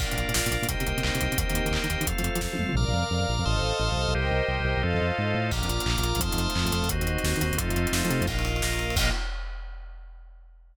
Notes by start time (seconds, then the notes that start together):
0.00 A#1 A#3 D4 F4 A#4 D5 F5, kick, crash
0.11 A#2, closed hi-hat
0.17 A#1, closed hi-hat
0.29 A#2, closed hi-hat
0.34 A#1, snare
0.46 A#2, closed hi-hat
0.51 A#1, closed hi-hat
0.62 A#2, closed hi-hat
0.68 C2 A#3 C4 D#4 G4 A#4 C5 D#5 G5, kick, closed hi-hat
0.80 C3, closed hi-hat
0.87 C2, closed hi-hat
0.97 C3, closed hi-hat
1.03 C2, clap
1.15 C3, closed hi-hat
1.21 C2, closed hi-hat
1.32 C3, closed hi-hat
1.38 D#2 A#3 C4 D#4 G4 A#4 C5 D#5 G5, kick, closed hi-hat
1.50 D#3, closed hi-hat
1.54 D#2, closed hi-hat
1.65 D#3, closed hi-hat
1.71 D#2, clap
1.84 D#3, closed hi-hat
1.90 D#2, closed hi-hat
2.01 D#3, closed hi-hat
2.07 F2 A3 C4 F4 A4 C5 F5, kick, closed hi-hat
2.18 F3, closed hi-hat
2.23 F2, closed hi-hat
2.35 F3, closed hi-hat
2.41 F2, kick, snare
2.53 F3, high tom
2.59 F2, mid tom
2.69 F3, floor tom
2.75 A#1 A#4 D5 F5 A#5 D6 F6
2.88 A#1
2.94 F2
3.11 F2
3.21 F2
3.29 A#1
3.39 F2
3.45 A1 A4 C5 D#5 F5 A5 C6 D#6 F6
3.56 A1
3.62 A1
3.80 A1
3.92 C2
3.96 C2
4.08 C2
4.13 C2 G4 A#4 C5 D#5 G5
4.26 C2
4.31 C2
4.48 C2
4.60 C2
4.65 C2
4.77 C2
4.83 F2 F4 A4 C5 D#5 F5
4.94 F2
5.01 F2
5.18 G#2
5.35 A2
5.51 A#1 A#3 D4 F4 A#5 D6 F6, kick, crash
5.63 F2, closed hi-hat
5.69 A#1, closed hi-hat
5.80 closed hi-hat
5.86 A#1 A#3 F4 A#4, clap
5.98 A#1, closed hi-hat
6.03 A#1, closed hi-hat
6.15 A#1, closed hi-hat
6.19 F2 A3 C4 D#4 F4 A5 C6 D#6 F6, kick, closed hi-hat
6.32 F2, closed hi-hat
6.37 F2, closed hi-hat
6.50 closed hi-hat
6.55 F2 A3 C4 F4 A4, clap
6.66 F2, closed hi-hat
6.72 F2, closed hi-hat
6.83 F2, closed hi-hat
6.89 D#2 C4 D#4 F#4 C5 D#5, kick, closed hi-hat
7.01 D#2, closed hi-hat
7.07 D#2, closed hi-hat
7.18 closed hi-hat
7.24 D#2, snare
7.36 D#3, closed hi-hat
7.41 D#2, closed hi-hat
7.52 D#2, closed hi-hat
7.58 F2 A3 C4 D#4 F4 A4 C5 D#5, kick, closed hi-hat
7.70 F2, closed hi-hat
7.76 F2, closed hi-hat
7.87 closed hi-hat
7.92 F2, snare
8.05 F3, closed hi-hat
8.10 C3, closed hi-hat
8.21 F2, closed hi-hat
8.27 A#1 A#3 D#4 F4 A#4 D#5 F5, kick, crash
8.39 ride
8.45 ride
8.56 ride
8.62 A#1 A#3 F4 A#4, snare
8.73 ride
8.79 ride
8.90 ride
8.96 A#1 A#3 D#4 F4 A#4 D#5 F5, kick, crash